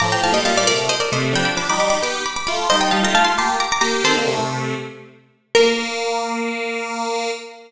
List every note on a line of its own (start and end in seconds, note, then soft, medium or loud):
0.00 0.21 A2 medium
0.00 0.21 F3 loud
0.00 0.10 A#5 medium
0.00 0.10 D6 medium
0.12 0.23 G5 medium
0.12 0.23 A#5 medium
0.23 0.33 A2 medium
0.23 0.33 F3 medium
0.23 0.34 F5 medium
0.23 0.34 A5 medium
0.33 0.43 A#2 medium
0.33 0.43 G3 medium
0.33 0.44 D#5 medium
0.33 0.44 G5 medium
0.45 0.65 A#2 medium
0.45 0.65 G3 medium
0.45 0.56 F5 medium
0.45 0.56 A5 medium
0.57 0.67 D5 medium
0.57 0.68 F5 medium
0.67 0.89 C3 medium
0.67 0.89 A3 medium
0.67 0.86 A#4 medium
0.67 0.86 D5 medium
0.89 1.00 C5 medium
0.89 1.00 D#5 medium
1.00 1.11 A#4 medium
1.00 1.11 D5 medium
1.12 1.34 C3 medium
1.12 1.34 A3 medium
1.12 1.32 C5 medium
1.12 1.32 D#5 medium
1.33 1.51 F3 medium
1.33 1.51 D4 medium
1.33 1.46 G5 medium
1.33 1.45 B5 medium
1.45 1.56 B5 medium
1.45 1.56 D6 medium
1.57 1.67 F3 medium
1.57 1.67 D4 medium
1.57 1.68 B5 medium
1.57 1.68 D6 medium
1.69 1.78 G3 medium
1.69 1.78 D#4 medium
1.69 1.79 B5 medium
1.69 1.79 D6 medium
1.79 1.98 G3 medium
1.79 1.98 D#4 medium
1.79 1.90 B5 medium
1.79 1.90 D6 medium
1.90 2.01 B5 medium
1.90 2.01 D6 medium
2.02 2.22 B3 medium
2.02 2.22 G4 medium
2.02 2.23 B5 medium
2.02 2.23 D6 medium
2.26 2.36 B5 medium
2.26 2.36 D6 medium
2.36 2.46 B5 medium
2.36 2.46 D6 medium
2.47 2.68 A3 medium
2.47 2.68 F4 medium
2.47 2.65 B5 medium
2.47 2.65 D6 medium
2.70 2.91 G3 medium
2.70 2.91 D#4 medium
2.70 2.80 C5 medium
2.70 2.80 D#5 medium
2.81 2.91 D#5 medium
2.81 2.91 G5 medium
2.91 3.03 G3 medium
2.91 3.03 D#4 medium
2.91 3.02 F5 medium
2.91 3.02 A5 medium
3.03 3.13 A3 medium
3.03 3.13 F4 medium
3.03 3.15 G5 medium
3.03 3.15 A#5 medium
3.13 3.34 A3 medium
3.13 3.34 F4 medium
3.13 3.25 F5 medium
3.13 3.24 A5 medium
3.25 3.35 A5 medium
3.25 3.35 C6 medium
3.38 3.56 A#3 medium
3.38 3.56 G4 medium
3.38 3.60 A5 medium
3.38 3.60 C6 medium
3.60 3.71 A#5 medium
3.60 3.71 D6 medium
3.72 3.81 A#5 medium
3.72 3.81 D6 medium
3.81 4.03 A#3 medium
3.81 4.03 G4 medium
3.81 4.02 A#5 medium
3.81 4.02 D6 medium
4.04 4.15 D#3 medium
4.04 4.15 C4 medium
4.04 4.97 A4 medium
4.04 4.97 C5 medium
4.17 4.28 D3 medium
4.17 4.28 A#3 medium
4.28 4.39 C3 medium
4.28 4.39 A3 medium
4.39 4.74 C3 medium
4.39 4.74 A3 medium
5.55 7.31 A#3 loud
5.55 7.30 A#4 loud